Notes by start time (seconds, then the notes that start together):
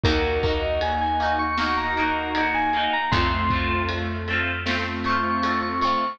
0.04 D#2 A#3 D#4 F#4 A#4, kick, ride
0.09 F#4
0.43 A#3 D#4 A#4, kick, ride
0.48 F#4
0.62 D#5
0.81 G#5, ride
1.01 G#5
1.20 A#3 D#4, ride
1.25 F#4
1.39 C#6
1.58 A#3 D#4 F#4 C#6, snare
1.63 F#4
1.77 A#5
1.97 A#3 D#4, ride
2.02 F#4
2.35 A#3 D#4, ride
2.40 F#4
2.54 G#5
2.73 A#3 D#4, ride
2.79 F#4
2.93 A#5
3.11 F2 A3 C4 F4 C6, kick, ride
3.17 F4
3.50 A3 C4, kick, ride
3.55 F4
3.89 ride
4.28 A3 C4, ride
4.33 F4
4.66 A3 C4 F4, snare
4.71 F4
5.04 A3 C4 C#6, ride
5.09 F4
5.42 A3 C4, ride
5.47 F4
5.62 C#6
5.81 A3 C4 C#6, ride
5.87 F4